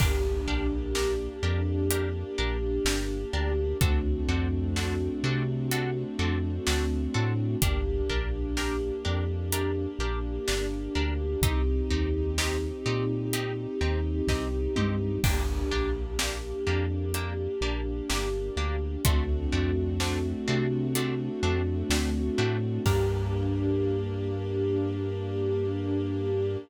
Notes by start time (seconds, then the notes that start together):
0.00 G1 A#3 D4 G4 A#4, kick, crash
0.47 A#1 D4 G4 A#4
0.95 D4 G4 A#4, snare
1.43 F2 D4 G4 A#4
1.90 D4 G4 A#4, closed hi-hat
2.38 A#1 D4 G4 A#4
2.85 G1 D4 G4 A#4, snare
3.33 D2 D4 G4 A#4
3.80 D2 A3 C4 D4 F#4 A4, kick, closed hi-hat
4.28 F2 C4 D4 F#4 A4
4.76 C4 D4 F#4 A4, snare
5.23 C3 C4 D4 F#4 A4
5.71 C4 D4 F#4 A4, closed hi-hat
6.19 F2 C4 D4 F#4 A4
6.67 D2 C4 D4 F#4 A4, snare
7.14 A2 C4 D4 F#4 A4
7.62 G1 A#3 D4 G4 A#4, kick, closed hi-hat
8.10 A#1 D4 G4 A#4
8.57 D4 G4 A#4, snare
9.05 F2 D4 G4 A#4
9.52 D4 G4 A#4, closed hi-hat
9.99 A#1 D4 G4 A#4
10.48 G1 D4 G4 A#4, snare
10.95 D2 D4 G4 A#4
11.41 C2 C4 D#4 G4, kick, closed hi-hat
11.90 D#2 C4 D#4 G4
12.38 C4 D#4 G4, snare
12.86 A#2 C4 D#4 G4
13.33 C4 D#4 G4, closed hi-hat
13.81 D#2 C4 D#4 G4
14.27 C2 C4 D#4 G4, kick, snare
14.76 G2 C4 D#4 G4, mid tom
15.24 G1 A#3 D4 G4, kick, crash
15.71 A#1 A#3 D4 G4
16.19 A#3 D4 G4, snare
16.67 F2 A#3 D4 G4
17.14 A#3 D4 G4, closed hi-hat
17.61 A#1 A#3 D4 G4
18.10 G1 A#3 D4 G4, snare
18.57 D2 A#3 D4 G4
19.05 D2 A3 C4 D4 F#4, kick, closed hi-hat
19.52 F2 A3 C4 D4 F#4
20.00 A3 C4 D4 F#4, snare
20.48 C3 A3 C4 D4 F#4
20.95 A3 C4 D4 F#4, closed hi-hat
21.43 F2 A3 C4 D4 F#4
21.90 D2 A3 C4 D4 F#4, snare
22.38 A2 A3 C4 D4 F#4
22.86 G2 A#3 D4 G4 A#4, kick, crash